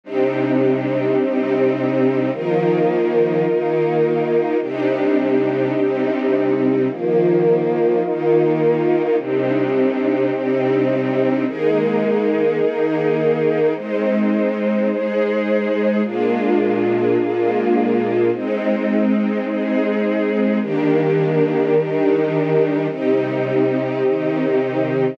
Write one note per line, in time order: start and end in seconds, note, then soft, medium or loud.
0.03 1.17 C3 medium
0.03 1.17 G3 medium
0.03 2.30 C4 medium
0.03 1.17 D4 medium
0.03 2.30 D4 medium
0.03 1.17 D#4 medium
0.03 2.30 D#4 medium
0.03 2.30 G4 medium
1.18 2.31 C3 medium
1.18 2.31 G3 medium
1.18 2.31 C4 loud
1.18 2.31 D#4 medium
2.32 3.45 D#3 loud
2.32 3.45 F3 medium
2.32 3.45 A#3 medium
2.32 4.58 D#4 medium
2.32 4.58 F4 medium
2.32 4.58 A#4 medium
3.46 4.60 D#3 medium
3.46 4.60 A#3 medium
3.46 4.60 D#4 medium
4.61 5.74 C3 medium
4.61 5.74 G3 medium
4.61 6.87 C4 medium
4.61 5.74 D4 medium
4.61 6.87 D4 medium
4.61 5.74 D#4 medium
4.61 6.87 D#4 medium
4.61 6.87 G4 medium
5.75 6.88 C3 medium
5.75 6.88 G3 medium
5.75 6.88 C4 medium
5.75 6.88 D#4 medium
6.89 8.02 D#3 medium
6.89 8.02 F3 medium
6.89 8.02 A#3 medium
6.89 9.16 D#4 medium
6.89 9.16 F4 medium
6.89 9.16 A#4 medium
8.03 9.17 D#3 loud
8.03 9.17 A#3 medium
8.03 9.17 D#4 loud
9.18 10.31 C3 medium
9.18 10.31 G3 medium
9.18 11.44 C4 medium
9.18 11.44 D4 medium
9.18 10.31 D4 medium
9.18 11.44 D#4 medium
9.18 10.31 D#4 medium
9.18 11.44 G4 medium
10.32 11.45 C3 medium
10.32 11.45 G3 medium
10.32 11.45 C4 loud
10.32 11.45 D#4 medium
11.46 12.60 D#3 medium
11.46 12.60 G#3 medium
11.46 12.60 A#3 medium
11.46 13.73 D#4 medium
11.46 13.73 G#4 medium
11.46 13.73 A#4 medium
12.61 13.74 D#3 medium
12.61 13.74 A#3 loud
12.61 13.74 D#4 medium
13.75 14.88 G#3 medium
13.75 16.01 G#3 medium
13.75 14.88 C4 medium
13.75 14.88 D#4 medium
13.75 16.01 D#4 medium
13.75 16.01 C5 medium
14.89 16.02 G#3 medium
14.89 16.02 D#4 medium
14.89 16.02 G#4 loud
16.03 17.17 A#2 medium
16.03 17.17 G#3 medium
16.03 18.30 A#3 medium
16.03 17.17 D4 medium
16.03 18.30 D4 medium
16.03 17.17 F4 medium
16.03 18.30 F4 medium
16.03 18.30 G#4 medium
17.18 18.31 A#2 medium
17.18 18.31 G#3 medium
17.18 18.31 A#3 medium
17.18 18.31 F4 medium
18.32 19.45 G#3 medium
18.32 20.59 G#3 medium
18.32 19.45 C4 medium
18.32 20.59 C4 medium
18.32 19.45 D#4 medium
18.32 20.59 D#4 medium
19.46 20.60 G#3 medium
19.46 20.60 D#4 medium
19.46 20.60 G#4 medium
20.61 21.74 D#3 medium
20.61 22.87 D#3 medium
20.61 21.74 G3 medium
20.61 21.74 A#3 medium
20.61 21.74 D4 medium
20.61 22.87 D4 medium
20.61 22.87 G4 medium
20.61 22.87 A#4 medium
21.75 22.88 D#3 loud
21.75 22.88 G3 medium
21.75 22.88 D4 medium
21.75 22.88 D#4 loud
22.89 24.02 C3 medium
22.89 24.02 G3 medium
22.89 25.15 C4 medium
22.89 25.15 D#4 medium
22.89 24.02 D#4 medium
22.89 25.15 G4 medium
24.03 25.17 C3 medium
24.03 25.17 D#3 medium
24.03 25.17 D#4 medium